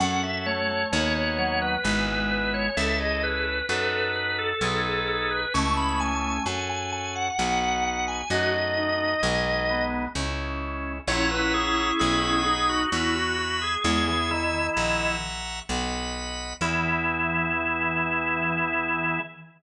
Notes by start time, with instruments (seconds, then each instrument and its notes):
0.00 electric bass (finger) F#2, drawbar organ C#4 F#4 A4 F#5
0.23 drawbar organ E5
0.46 drawbar organ A3 C#5
0.69 drawbar organ A3
0.92 electric bass (finger) D#2, drawbar organ B3 D#4 F#4 C#5
1.15 drawbar organ C#5
1.38 drawbar organ F#3 C#5
1.62 drawbar organ B4
1.84 electric bass (finger) G#1, drawbar organ G#3 B3 E4 G#4 B4
2.08 drawbar organ B4
2.31 drawbar organ B4
2.54 drawbar organ C#5
2.77 electric bass (finger) C#2, drawbar organ C#4 E4 A4 E5
3.00 drawbar organ G#4 D#5
3.23 drawbar organ B4
3.69 electric bass (finger) F#2, drawbar organ D#4 F#4 A4 B4
3.92 drawbar organ B4
4.15 drawbar organ B4
4.38 drawbar organ A4
4.61 electric bass (finger) B1, drawbar organ D#4 G#4 A4 B4
4.85 drawbar organ A4
5.08 drawbar organ A4
5.31 drawbar organ B4
5.54 electric bass (finger) C#2, drawbar organ A3 C#4 E4 G#4 C#6
5.77 drawbar organ B5
6.00 drawbar organ G#5
6.45 electric bass (finger) F#2, drawbar organ C#4 F#4 A4 G#5
6.69 drawbar organ G#5
6.92 drawbar organ G#5
7.15 drawbar organ F#5
7.38 electric bass (finger) B1, drawbar organ B3 D#4 F#4 F#5
7.62 drawbar organ F#5
7.85 drawbar organ F#5
8.08 drawbar organ G#5
8.30 electric bass (finger) F#2, drawbar organ A3 D#4 F#4 D#5
8.77 drawbar organ D#4
9.00 drawbar organ D#4
9.22 electric bass (finger) B1, drawbar organ G#3 B3 D#4
9.69 drawbar organ B3
10.15 electric bass (finger) C#2, drawbar organ G#3 C#4 E4
11.08 electric bass (finger) A#1, drawbar organ C#4 E4 C#5 E5 F#5 A#5
11.31 drawbar organ B4
11.54 drawbar organ G#4
11.99 electric bass (finger) B1, drawbar organ G#4 D#5 F#5 B5
12.23 drawbar organ G#4
12.46 drawbar organ D#4 G#4
12.69 drawbar organ F#4
12.92 electric bass (finger) E2, drawbar organ E4 F#4 E5 G#5 B5
13.15 drawbar organ F#4
13.38 drawbar organ F#4
13.62 drawbar organ G#4
13.84 electric bass (finger) E2, drawbar organ G#3 G#4 E5 G#5 C#6
14.08 drawbar organ E3 G#4
14.31 drawbar organ D#3 E4
14.77 electric bass (finger) A#1, drawbar organ E5 F#5 A#5 C#6
15.69 electric bass (finger) B1, drawbar organ D#5 F#5 B5
16.61 electric bass (finger) E2, drawbar organ E3 B3 E4 G#4